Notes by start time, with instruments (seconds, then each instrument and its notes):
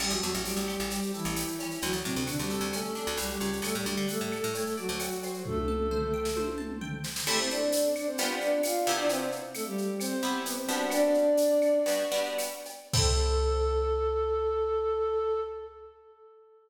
0.00 electric bass (finger) A1, flute G3 G4, acoustic guitar (steel) C4, crash, cowbell, claves
0.10 electric bass (finger) A1, flute F#3 F#4, shaker
0.22 electric bass (finger) E2, flute F#3 F#4, acoustic guitar (steel) A4, shaker
0.34 electric bass (finger) A1, shaker
0.45 flute G3 G4, acoustic guitar (steel) C4, tambourine, shaker
0.56 electric bass (finger) A1, shaker
0.67 acoustic guitar (steel) G4, claves, shaker
0.79 electric bass (finger) A1, shaker
0.90 flute G3 G4, acoustic guitar (steel) C4, cowbell, shaker
1.03 shaker
1.14 flute E3 E4, acoustic guitar (steel) A4, shaker
1.25 electric bass (finger) A1, shaker
1.36 acoustic guitar (steel) G4, tambourine, cowbell, claves, shaker
1.48 shaker
1.59 acoustic guitar (steel) C#4, cowbell, shaker
1.71 shaker
1.82 electric bass (finger) D2, flute F#3 F#4, cowbell, shaker
1.93 electric bass (finger) D2, shaker
2.04 electric bass (finger) A2, flute C3 C4, acoustic guitar (steel) D4, shaker
2.16 electric bass (finger) D2, shaker
2.27 flute D3 D4, acoustic guitar (steel) F#4, tambourine, claves, shaker
2.39 electric bass (finger) D2, flute G3 G4, shaker
2.50 acoustic guitar (steel) A4, shaker
2.61 electric bass (finger) D2, shaker
2.73 flute A3 A4, acoustic guitar (steel) C#4, cowbell, claves, shaker
2.84 shaker
2.95 acoustic guitar (steel) D4, shaker
3.07 electric bass (finger) D2, shaker
3.17 electric bass (finger) C2, flute G3 G4, acoustic guitar (steel) F#4, tambourine, cowbell, shaker
3.30 flute G3 G4, shaker
3.40 electric bass (finger) C#2, acoustic guitar (steel) C#5, cowbell, shaker
3.53 shaker
3.62 electric bass (finger) D2, flute A3 A4, cowbell, claves, shaker
3.75 electric bass (finger) A2, flute G3 G4, shaker
3.85 electric bass (finger) D2, flute G3 G4, acoustic guitar (steel) D5, shaker
3.97 electric bass (finger) D3, shaker
4.08 flute A3 A4, acoustic guitar (steel) F#5, tambourine, shaker
4.21 electric bass (finger) A2
4.31 acoustic guitar (steel) A5, claves, shaker
4.43 electric bass (finger) A2, shaker
4.54 flute A3 A4, acoustic guitar (steel) C#5, cowbell, shaker
4.66 shaker
4.77 flute F#3 F#4, acoustic guitar (steel) D5, shaker
4.89 electric bass (finger) D2, shaker
5.00 acoustic guitar (steel) F#5, tambourine, cowbell, claves, shaker
5.11 shaker
5.23 acoustic guitar (steel) C5, cowbell, shaker
5.34 shaker
5.45 flute A3 A4, kick, high tom
5.57 high tom
5.68 acoustic guitar (steel) A5, mid tom
5.80 mid tom
5.91 acoustic guitar (steel) C5, floor tom
6.02 floor tom
6.14 acoustic guitar (steel) G5
6.25 snare
6.36 acoustic guitar (steel) C5, high tom
6.48 high tom
6.58 acoustic guitar (steel) A5, mid tom
6.70 mid tom
6.81 acoustic guitar (steel) G5, floor tom
6.93 floor tom
7.04 acoustic guitar (steel) C5, snare
7.16 snare
7.27 acoustic guitar (steel) A3 C4 E4 G4, flute A3 A4, crash, cowbell, claves
7.39 flute C4 C5
7.50 flute D4 D5, shaker
7.72 tambourine, shaker
7.95 flute D4 D5, claves, shaker
8.07 flute C4 C5
8.18 acoustic guitar (steel) G3 B3 D4 F4, flute B3 B4, cowbell, shaker
8.41 flute D4 D5, shaker
8.63 flute F4 F5, tambourine, cowbell, claves, shaker
8.86 acoustic guitar (steel) C3 B3 E4 G4, cowbell, shaker
8.98 flute D4 D5
9.09 flute C4 C5, cowbell, shaker
9.32 shaker
9.54 flute A3 A4, tambourine, claves, shaker
9.66 flute G3 G4
9.78 shaker
10.00 flute C4 C5, cowbell, claves, shaker
10.23 acoustic guitar (steel) C3 B3 E4 G4, shaker
10.45 flute B3 B4, tambourine, cowbell, shaker
10.57 flute C4 C5
10.68 acoustic guitar (steel) G3 B3 D4 F#4, cowbell, shaker
10.90 flute D4 D5, cowbell, claves, shaker
11.14 shaker
11.37 tambourine, shaker
11.62 claves, shaker
11.86 acoustic guitar (steel) G3 B3 D4 F#4, cowbell, shaker
12.12 acoustic guitar (steel) G3 B3 D4 F#4, shaker
12.25 shaker
12.38 tambourine, cowbell, claves, shaker
12.65 cowbell, shaker
12.93 acoustic guitar (steel) C4 E4 G4 A4, flute A4, kick, crash